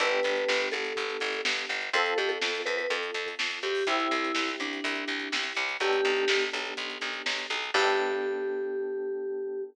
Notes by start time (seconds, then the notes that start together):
0.00 G1 B3 D4 G4 A4 B4, kick, closed hi-hat
0.12 closed hi-hat
0.23 G1, closed hi-hat
0.36 closed hi-hat
0.48 G1, snare
0.61 closed hi-hat
0.72 G1 A4, closed hi-hat
0.85 closed hi-hat
0.96 G1, kick, closed hi-hat
1.10 closed hi-hat
1.20 G1, closed hi-hat
1.33 closed hi-hat
1.45 G1, snare
1.57 closed hi-hat
1.69 G1, closed hi-hat
1.81 closed hi-hat
1.93 F2 C4 F4 A4, kick, closed hi-hat
2.06 closed hi-hat
2.18 F2 G4, closed hi-hat
2.29 A4, closed hi-hat
2.42 F2, snare
2.55 closed hi-hat
2.66 F2 B4, closed hi-hat
2.77 B4, closed hi-hat
2.90 F2 A4, kick, closed hi-hat
3.03 closed hi-hat
3.14 F2, closed hi-hat
3.26 kick, closed hi-hat
3.39 F2, snare
3.51 kick, closed hi-hat
3.63 F2 G4, closed hi-hat
3.75 open hi-hat
3.87 C2 C4 E4 G4, kick, closed hi-hat
4.00 closed hi-hat
4.11 C2, closed hi-hat
4.24 closed hi-hat
4.35 C2, snare
4.48 closed hi-hat
4.60 C2 D4, closed hi-hat
4.73 closed hi-hat
4.84 C2, kick, closed hi-hat
4.95 closed hi-hat
5.08 C2, closed hi-hat
5.19 kick, closed hi-hat
5.32 C2, snare
5.43 closed hi-hat
5.55 C2, closed hi-hat
5.69 closed hi-hat
5.80 B1 B3 D4 G4 A4, kick, closed hi-hat
5.93 closed hi-hat
6.05 B1, closed hi-hat
6.16 closed hi-hat
6.28 B1, snare
6.41 closed hi-hat
6.53 B1, closed hi-hat
6.65 closed hi-hat
6.77 B1, kick, closed hi-hat
6.90 closed hi-hat
7.01 B1, closed hi-hat
7.13 kick, closed hi-hat
7.26 B1, snare
7.38 closed hi-hat
7.50 B1, closed hi-hat
7.63 closed hi-hat
7.74 G2 B3 D4 G4 A4, kick, crash